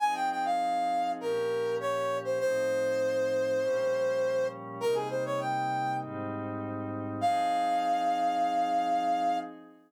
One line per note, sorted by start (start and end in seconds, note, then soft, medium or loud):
0.00 1.19 F3 medium
0.00 1.19 C4 medium
0.00 1.19 D#4 medium
0.00 1.19 G#4 medium
0.00 0.14 G#5 medium
0.15 0.29 G5 medium
0.30 0.45 G5 medium
0.45 1.11 F5 medium
1.20 2.39 A#2 medium
1.20 2.39 F3 medium
1.20 2.39 C#4 medium
1.20 2.39 G4 medium
1.20 1.75 A#4 medium
1.80 2.17 C#5 medium
2.24 2.39 C5 medium
2.40 3.59 A2 medium
2.40 3.59 F3 medium
2.40 3.59 C4 medium
2.40 3.59 D#4 medium
2.40 4.47 C5 loud
3.60 4.78 A#2 medium
3.60 4.78 F3 medium
3.60 4.78 G3 medium
3.60 4.78 C#4 medium
4.80 5.99 C3 medium
4.80 5.99 G3 medium
4.80 5.99 A#3 medium
4.80 5.99 D#4 medium
4.80 4.95 A#4 loud
4.94 5.08 G#4 medium
5.09 5.24 C5 medium
5.25 5.39 C#5 medium
5.40 5.96 G5 medium
6.00 7.19 G#2 medium
6.00 7.19 G3 medium
6.00 7.19 C4 medium
6.00 7.19 D#4 medium
7.20 9.37 F3 medium
7.20 9.37 C4 medium
7.20 9.37 D#4 loud
7.20 9.37 G#4 loud
7.20 9.38 F5 loud